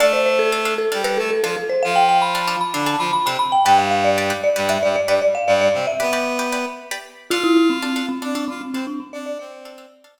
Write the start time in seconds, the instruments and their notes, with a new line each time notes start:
0.00 clarinet A3 A4, pizzicato strings D4 A4 F5, marimba D5
0.13 marimba C5
0.26 marimba C5
0.39 marimba A4
0.52 pizzicato strings D4 A4 F5
0.65 pizzicato strings D4 A4 F5
0.78 marimba A4
0.92 clarinet G3 G4, pizzicato strings D4 A4 F5
1.04 pizzicato strings D4 A4 F5, marimba B4
1.17 clarinet A3 A4, marimba A4
1.31 marimba A4
1.43 clarinet F3 F4, pizzicato strings D4 A4 F5, marimba A4
1.57 marimba A4
1.69 marimba C5
1.83 clarinet F3 F4, marimba F5
1.96 marimba G5
2.09 marimba G5
2.22 marimba B5
2.35 pizzicato strings D4 A4 F5
2.47 pizzicato strings D4 A4 F5
2.61 marimba B5
2.73 clarinet D3 D4, pizzicato strings D4 A4 F5
2.86 pizzicato strings D4 A4 F5, marimba A5
2.99 clarinet F3 F4, marimba B5
3.13 marimba B5
3.25 clarinet C3 C4, pizzicato strings D4 A4 F5, marimba B5
3.39 marimba B5
3.52 marimba G5
3.65 clarinet G2 G3, pizzicato strings G4 B4 D5, marimba G5
3.78 marimba F5
3.91 marimba F5
4.04 marimba D5
4.18 pizzicato strings G4 B4 D5
4.30 pizzicato strings G4 B4 D5
4.44 marimba D5
4.56 clarinet G2 G3, pizzicato strings G4 B4 D5
4.69 pizzicato strings G4 B4 D5, marimba E5
4.83 clarinet G2 G3, marimba D5
4.96 marimba D5
5.07 clarinet G2 G3, pizzicato strings G4 B4 D5, marimba D5
5.22 marimba D5
5.35 marimba F5
5.47 clarinet G2 G3, marimba D5
5.61 marimba D5
5.74 clarinet C3 C4
5.87 marimba E5
6.00 clarinet B3 B4, pizzicato strings G4 B4 D5
6.13 pizzicato strings G4 B4 D5
6.39 pizzicato strings G4 B4 D5
6.52 pizzicato strings G4 B4 D5
6.91 pizzicato strings G4 B4 D5
7.30 pizzicato strings D4 A4 F5, clarinet F4 F5, marimba F4
7.43 marimba E4
7.57 marimba E4
7.70 marimba C4
7.82 pizzicato strings D4 A4 F5
7.96 pizzicato strings D4 A4 F5
8.09 marimba C4
8.22 pizzicato strings D4 A4 F5, clarinet D4 D5
8.35 marimba D4, pizzicato strings D4 A4 F5
8.48 marimba C4, clarinet F4 F5
8.61 marimba C4
8.73 clarinet C4 C5, marimba C4, pizzicato strings D4 A4 F5
8.87 marimba D4
9.00 marimba C4
9.13 clarinet D4 D5, marimba D5
9.26 marimba D5
9.39 clarinet C4 C5, marimba D5
9.65 pizzicato strings D4 A4 F5
9.78 pizzicato strings D4 A4 F5
10.04 pizzicato strings D4 A4 F5
10.18 pizzicato strings D4 A4 F5